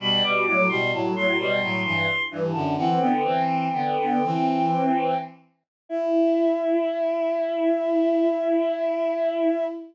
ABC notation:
X:1
M:3/4
L:1/16
Q:1/4=65
K:Em
V:1 name="Choir Aahs"
b d' d' c' a c' c'2 c'2 z a | "^rit." f g9 z2 | e12 |]
V:2 name="Violin"
[B,,G,] [B,,G,] [A,,F,] [B,,G,] [A,,F,] [A,,F,] [B,,G,] [A,,F,] [G,,E,] z [G,,E,] [F,,D,] | "^rit." [E,C] [D,B,] [E,C]2 [D,B,] [D,B,] [E,C]4 z2 | E12 |]